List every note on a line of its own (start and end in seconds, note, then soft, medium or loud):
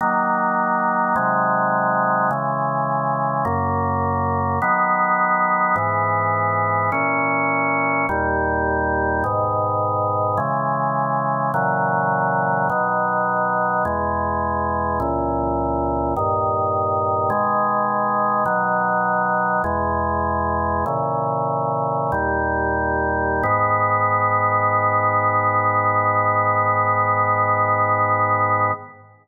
0.01 1.15 D#3 loud
0.01 1.15 F#3 medium
0.01 1.15 A#3 loud
1.16 2.30 C3 loud
1.16 2.30 D#3 loud
1.16 2.30 F#3 loud
1.16 2.30 G#3 medium
2.31 3.44 C#3 loud
2.31 3.45 E3 loud
2.31 3.45 G#3 medium
3.45 4.59 F#2 loud
3.45 4.59 C#3 loud
3.45 4.59 A#3 loud
4.62 5.76 D#3 loud
4.62 5.76 F#3 loud
4.62 5.75 B3 loud
5.76 6.90 G#2 loud
5.76 6.90 E3 loud
5.76 6.90 B3 medium
6.92 8.06 A#2 medium
6.92 8.06 E3 loud
6.92 8.06 C#4 loud
8.09 9.23 D#2 loud
8.09 9.23 A#2 loud
8.09 9.23 G3 loud
9.24 10.38 G#2 loud
9.24 10.38 B2 loud
9.24 10.38 D#3 loud
10.37 11.52 C#3 loud
10.37 11.52 E3 loud
10.37 11.52 G#3 medium
11.54 12.68 A#2 medium
11.54 12.68 C#3 loud
11.54 12.68 E3 loud
11.54 12.68 F#3 loud
12.69 13.84 B2 loud
12.69 13.84 D#3 loud
12.69 13.84 F#3 medium
13.85 14.99 E2 medium
13.85 14.99 B2 loud
13.85 14.99 G#3 medium
15.00 16.14 C#2 loud
15.00 16.14 A#2 medium
15.00 16.14 E3 loud
16.16 17.31 G2 medium
16.16 17.31 A#2 medium
16.16 17.29 D#3 loud
17.30 18.44 B2 medium
17.30 18.44 D#3 loud
17.30 18.44 G#3 loud
18.45 19.62 B2 medium
18.45 19.62 D#3 loud
18.45 19.62 F#3 loud
19.64 20.85 E2 loud
19.64 20.85 B2 loud
19.64 20.85 G#3 loud
20.86 22.11 A#2 medium
20.86 22.11 C#3 medium
20.86 22.11 E3 loud
22.12 23.43 D#2 medium
22.12 23.43 A#2 loud
22.12 23.43 G3 loud
23.43 28.71 G#2 loud
23.43 28.71 D#3 loud
23.43 28.71 B3 loud